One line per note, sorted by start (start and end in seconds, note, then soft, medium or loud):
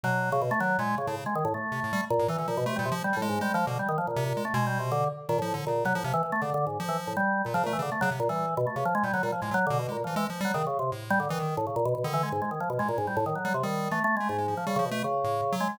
0.04 0.54 B2 medium
0.04 0.29 F#3 medium
0.32 0.41 C#3 loud
0.42 0.50 B2 loud
0.51 0.59 A3 loud
0.60 0.77 D#3 medium
0.60 0.77 F#3 loud
0.78 0.95 A#2 loud
0.78 0.96 G#3 medium
0.98 1.06 C#3 medium
1.07 1.16 A2 medium
1.07 1.24 C#3 medium
1.26 1.34 G#3 medium
1.35 1.44 D#3 medium
1.45 1.53 A2 loud
1.54 2.05 A3 soft
1.72 1.80 C3 medium
1.84 1.92 A2 medium
1.93 2.01 G3 loud
2.10 2.27 A#2 loud
2.19 2.28 A2 loud
2.28 2.37 E3 loud
2.28 2.38 E3 medium
2.38 2.47 D3 medium
2.38 2.47 E3 medium
2.48 2.56 A#2 medium
2.48 2.64 F3 medium
2.57 2.66 B2 loud
2.66 2.75 C3 medium
2.66 2.77 A3 loud
2.76 2.90 A#2 loud
2.76 2.84 G3 medium
2.85 2.94 C3 medium
2.92 3.03 F3 loud
3.04 3.15 G3 medium
3.13 3.28 A2 medium
3.13 3.21 G3 medium
3.22 3.39 G#3 loud
3.29 3.40 G#2 medium
3.41 3.53 G3 medium
3.41 3.52 G#3 loud
3.54 3.65 F3 loud
3.54 3.66 G#3 medium
3.67 3.78 B2 loud
3.67 3.78 D3 medium
3.79 3.88 G3 medium
3.89 3.97 D#3 medium
3.98 4.06 F3 medium
4.07 4.24 A#2 medium
4.16 4.33 C3 loud
4.26 4.43 A#2 medium
4.37 4.45 G#3 medium
4.45 4.53 A3 medium
4.54 5.04 B2 loud
4.54 4.65 G#3 medium
4.67 4.78 G3 medium
4.79 4.90 C3 medium
4.92 5.09 D3 loud
5.29 5.38 A#2 loud
5.29 5.40 D#3 medium
5.39 5.55 A2 medium
5.39 5.53 F3 loud
5.54 5.65 D3 medium
5.67 5.84 A#2 medium
5.67 5.85 C#3 medium
5.85 5.93 C3 medium
5.85 5.94 F#3 loud
5.95 6.03 A2 medium
5.95 6.04 F3 loud
6.04 6.13 C3 loud
6.04 6.13 F3 medium
6.14 6.22 E3 loud
6.23 6.31 E3 medium
6.32 6.41 A3 loud
6.42 6.50 C#3 medium
6.42 6.53 D3 medium
6.54 6.65 D3 loud
6.67 6.78 G#2 medium
6.80 7.13 F3 loud
6.89 6.97 E3 medium
7.07 7.16 A2 medium
7.17 7.42 G3 medium
7.45 7.53 A#2 medium
7.45 7.54 A#2 medium
7.54 7.66 C#3 medium
7.54 7.63 F3 loud
7.64 7.72 A#2 medium
7.64 7.78 A3 loud
7.73 7.81 E3 medium
7.79 7.90 C#3 loud
7.79 7.91 D3 medium
7.92 8.00 A3 medium
8.01 8.11 C#3 loud
8.01 8.09 F#3 loud
8.11 8.20 C3 medium
8.20 8.28 A#2 loud
8.29 8.54 E3 medium
8.29 8.46 G3 medium
8.57 8.66 B2 loud
8.67 8.75 A3 soft
8.76 8.84 C3 medium
8.76 8.84 C#3 medium
8.85 8.94 F3 loud
8.95 9.03 G#3 loud
9.03 9.12 A#2 medium
9.03 9.13 G3 medium
9.14 9.22 D3 medium
9.14 9.22 F#3 loud
9.23 9.31 A#2 medium
9.23 9.31 G3 medium
9.32 9.41 F3 medium
9.42 9.50 A2 medium
9.42 9.53 G#3 medium
9.51 9.60 F#3 medium
9.51 9.65 F#3 loud
9.67 9.87 B2 loud
9.67 9.78 D3 loud
9.79 9.90 B2 medium
9.89 10.03 A#2 medium
9.89 9.97 G#3 medium
10.04 10.15 E3 medium
10.04 10.15 F3 soft
10.16 10.25 E3 medium
10.16 10.27 G#3 loud
10.30 10.41 F3 medium
10.41 10.52 G3 loud
10.45 10.53 F#3 medium
10.54 10.63 C#3 medium
10.54 10.65 D#3 medium
10.67 10.78 C#3 medium
10.79 10.90 C3 medium
10.92 11.26 A2 medium
11.10 11.19 G3 loud
11.20 11.28 D3 medium
11.29 11.54 D#3 medium
11.29 11.39 E3 loud
11.39 11.56 D#3 medium
11.57 11.66 A2 medium
11.67 11.75 C#3 medium
11.76 11.84 A#2 medium
11.85 11.94 B2 loud
11.95 12.03 B2 medium
12.04 12.29 D3 loud
12.04 12.13 D#3 medium
12.14 12.22 E3 medium
12.23 12.31 G#3 medium
12.32 12.41 G#2 medium
12.42 12.50 G#3 medium
12.51 12.59 D#3 medium
12.60 12.69 F3 medium
12.70 12.78 B2 medium
12.79 13.30 A2 soft
12.79 12.88 G#3 medium
12.89 12.97 A#2 medium
12.98 13.06 G#2 medium
13.07 13.16 G3 medium
13.17 13.25 A2 loud
13.26 13.34 D#3 medium
13.35 13.44 F#3 medium
13.45 13.53 F#3 medium
13.45 13.53 G3 medium
13.54 13.63 C3 medium
13.63 13.89 D#3 medium
13.63 13.89 G3 medium
13.91 14.00 E3 medium
13.91 14.03 A3 medium
14.04 14.15 A3 loud
14.17 14.28 G#3 medium
14.17 14.37 A3 medium
14.29 14.54 G#2 medium
14.38 14.47 G#3 medium
14.48 14.65 F3 medium
14.57 14.66 F3 medium
14.67 14.75 C#3 medium
14.67 14.78 G3 loud
14.76 14.84 C#3 loud
14.76 14.90 F3 medium
14.85 15.02 B2 medium
14.91 15.03 A3 loud
15.04 15.55 C#3 medium
15.24 15.41 A2 medium
15.52 15.68 F#3 loud
15.60 15.77 G#3 medium
15.69 15.77 F#3 medium